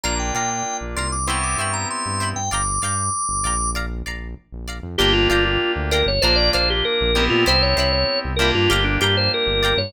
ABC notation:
X:1
M:4/4
L:1/16
Q:1/4=97
K:Gdor
V:1 name="Drawbar Organ"
b g g g2 z c' d' ^c' d' _d' b =c'3 g | d'8 z8 | G F F F2 z B _d c =d c G B3 F | c _d d d2 z B F G =D G c B3 _d |]
V:2 name="Acoustic Guitar (steel)"
[dfb]2 [dfb]4 [dfb]2 [ceg=b]2 [cegb]4 [cegb]2 | [dfgb]2 [dfgb]4 [dfgb]2 [dfb]2 [dfb]4 [dfb]2 | [dfgb]2 [dfgb]4 [dfgb]2 [dfb]2 [dfb]4 [dfb]2 | [ceg=b]2 [cegb]4 [cegb]2 [dfg_b]2 [dfgb]4 [dfgb]2 |]
V:3 name="Electric Piano 2"
[B,DF]8 [=B,CEG]8 | z16 | [B,DFG]8 [B,DF]6 [=B,CEG]2- | [=B,CEG]6 [_B,DFG]10 |]
V:4 name="Synth Bass 1" clef=bass
B,,,2 B,,3 B,,, C,,4 G,,3 G,,2 G,, | G,,,2 G,,3 G,,, B,,,4 B,,,3 B,,,2 F,, | G,,,2 G,,,3 D,,2 G,,, B,,,2 B,,,3 B,,,2 B,, | C,,2 C,,3 C,,2 G,, G,,,2 G,,3 G,,,2 G,, |]